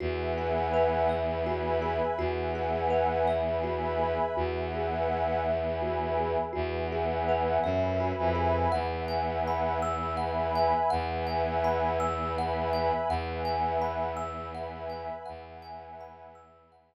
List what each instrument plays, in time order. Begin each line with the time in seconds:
0.00 violin E2, kalimba F#4, pad 5 (bowed) B4 E5 F#5 G#5
0.38 kalimba G#4
0.74 kalimba B4
1.09 pad 5 (bowed) B4 E5 G#5 B5, kalimba E5
1.46 kalimba F#4
1.82 kalimba G#4
2.18 violin E2, kalimba F#4, pad 5 (bowed) B4 E5 F#5 G#5
2.55 kalimba G#4
2.90 kalimba B4
3.27 pad 5 (bowed) B4 E5 G#5 B5, kalimba E5
3.63 kalimba F#4
3.99 kalimba G#4
4.36 violin E2, kalimba F#4, pad 5 (bowed) B4 E5 F#5 G#5
4.74 kalimba G#4
5.09 kalimba B4
5.46 pad 5 (bowed) B4 E5 G#5 B5, kalimba E5
5.82 kalimba F#4
6.17 kalimba G#4
6.53 violin E2, kalimba F#4, pad 5 (bowed) B4 E5 F#5 G#5
6.92 kalimba G#4
7.28 kalimba B4
7.63 violin F#2, pad 5 (bowed) B4 E5 G#5 B5, kalimba E5
8.00 kalimba F#4
8.18 violin F2
8.35 kalimba G#4
8.72 violin E2, pad 5 (bowed) B4 E5 F#5 G#5, kalimba F#5
9.08 kalimba G#5
9.47 kalimba B5
9.82 pad 5 (bowed) B4 E5 G#5 B5, kalimba E6
10.17 kalimba F#5
10.55 kalimba G#5
10.90 violin E2, pad 5 (bowed) B4 E5 F#5 G#5, kalimba F#5
11.27 kalimba G#5
11.64 kalimba B5
12.00 pad 5 (bowed) B4 E5 G#5 B5, kalimba E6
12.38 kalimba F#5
12.73 kalimba G#5
13.09 violin E2, pad 5 (bowed) B4 E5 F#5 G#5, kalimba F#5
13.45 kalimba G#5
13.82 kalimba B5
14.17 pad 5 (bowed) B4 E5 G#5 B5, kalimba E6
14.55 kalimba F#5
14.90 kalimba G#5
15.26 violin E2, pad 5 (bowed) B4 E5 F#5 G#5, kalimba F#5
15.62 kalimba G#5
16.01 kalimba B5
16.35 pad 5 (bowed) B4 E5 G#5 B5, kalimba E6
16.72 kalimba F#5